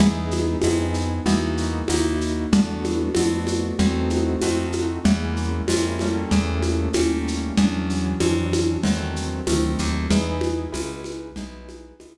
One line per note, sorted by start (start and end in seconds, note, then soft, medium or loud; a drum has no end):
0.00 0.56 E2 loud
0.00 0.56 B3 medium
0.00 0.56 D#4 medium
0.00 0.56 E4 medium
0.00 0.56 G#4 medium
0.00 low conga loud
0.00 shaker medium
0.31 high conga medium
0.31 shaker medium
0.62 1.20 F2 medium
0.62 1.20 B3 medium
0.62 1.20 D#4 medium
0.62 1.20 E4 medium
0.62 1.20 G#4 medium
0.62 tambourine medium
0.62 high conga medium
0.62 shaker medium
0.94 shaker medium
1.26 1.83 E2 loud
1.26 1.82 A#3 loud
1.26 1.82 D#4 loud
1.26 1.82 E4 medium
1.26 1.82 F#4 loud
1.26 low conga medium
1.26 shaker medium
1.57 shaker medium
1.88 2.46 D#2 medium
1.88 2.46 A#3 medium
1.88 2.46 D#4 medium
1.88 2.46 E4 medium
1.88 2.46 F#4 medium
1.88 tambourine medium
1.88 high conga medium
1.88 shaker medium
2.21 shaker medium
2.52 3.09 E2 loud
2.52 3.09 A3 loud
2.52 3.09 B3 medium
2.52 3.09 D4 loud
2.52 3.09 F#4 medium
2.52 low conga loud
2.52 shaker medium
2.84 high conga medium
2.84 shaker medium
3.15 3.73 F2 medium
3.15 3.73 A3 medium
3.15 3.73 B3 medium
3.15 3.73 D4 medium
3.15 3.73 F#4 medium
3.15 tambourine medium
3.15 high conga medium
3.15 shaker medium
3.47 high conga medium
3.47 shaker medium
3.79 4.36 E2 loud
3.79 4.36 A3 medium
3.79 4.36 C4 loud
3.79 4.36 D#4 medium
3.79 4.36 F#4 medium
3.79 low conga medium
3.79 shaker medium
4.10 high conga medium
4.10 shaker medium
4.41 4.99 F2 medium
4.41 5.00 A3 medium
4.41 5.00 C4 medium
4.41 5.00 D#4 medium
4.41 5.00 F#4 medium
4.41 tambourine medium
4.41 high conga medium
4.41 shaker medium
4.72 high conga medium
4.72 shaker medium
5.04 5.62 E2 loud
5.04 5.61 G#3 medium
5.04 5.61 A#3 medium
5.04 5.61 C#4 medium
5.04 5.61 E4 medium
5.04 low conga medium
5.04 shaker medium
5.36 shaker medium
5.68 6.25 F2 medium
5.68 6.00 G#3 medium
5.68 6.00 A#3 medium
5.68 6.00 C#4 medium
5.68 6.00 E4 medium
5.68 tambourine medium
5.68 high conga medium
5.68 shaker medium
5.99 6.89 G3 loud
5.99 6.89 A3 loud
5.99 6.89 A#3 loud
5.99 6.89 C#4 medium
5.99 high conga medium
5.99 shaker medium
6.31 6.89 E2 loud
6.31 low conga medium
6.31 shaker medium
6.62 high conga medium
6.62 shaker medium
6.93 7.51 D#2 medium
6.93 7.53 G3 medium
6.93 7.53 A3 medium
6.93 7.53 A#3 medium
6.93 7.53 C#4 medium
6.93 tambourine medium
6.93 high conga medium
6.93 shaker medium
7.28 shaker medium
7.57 8.15 E2 loud
7.57 8.15 E3 medium
7.57 8.15 F#3 loud
7.57 8.15 C#4 loud
7.57 8.15 D4 medium
7.57 low conga medium
7.57 shaker medium
7.90 shaker medium
8.20 8.78 F2 loud
8.20 8.78 E3 medium
8.20 8.78 F#3 medium
8.20 8.78 C#4 medium
8.20 8.78 D4 medium
8.20 tambourine medium
8.20 high conga medium
8.20 shaker medium
8.53 high conga medium
8.53 shaker medium
8.83 9.41 E2 loud
8.83 9.41 D#3 medium
8.83 9.41 F#3 medium
8.83 9.41 A3 medium
8.83 9.41 C4 medium
8.83 low conga medium
8.83 shaker medium
9.16 shaker medium
9.47 9.76 D2 medium
9.47 10.04 D#3 medium
9.47 10.04 F#3 medium
9.47 10.04 A3 medium
9.47 10.04 C4 medium
9.47 tambourine medium
9.47 high conga medium
9.47 shaker medium
9.79 10.08 D#2 medium
9.79 shaker medium
10.10 10.67 E2 loud
10.10 10.67 D#4 loud
10.10 10.67 E4 medium
10.10 10.67 G#4 loud
10.10 10.67 B4 medium
10.10 low conga medium
10.10 shaker medium
10.41 high conga medium
10.41 shaker medium
10.72 11.31 C#2 medium
10.72 11.29 D#4 medium
10.72 11.29 E4 medium
10.72 11.29 G#4 medium
10.72 11.29 B4 medium
10.72 tambourine medium
10.72 high conga medium
10.72 shaker medium
11.04 high conga medium
11.04 shaker medium
11.36 11.93 B1 medium
11.36 11.94 D#4 medium
11.36 11.94 E4 medium
11.36 11.94 G#4 medium
11.36 11.94 B4 medium
11.36 low conga medium
11.36 shaker medium
11.69 high conga medium
11.69 shaker medium
12.00 12.18 C#2 medium
12.00 12.18 D#4 medium
12.00 12.18 E4 medium
12.00 12.18 G#4 medium
12.00 12.18 B4 medium
12.00 tambourine medium
12.00 high conga medium
12.00 shaker medium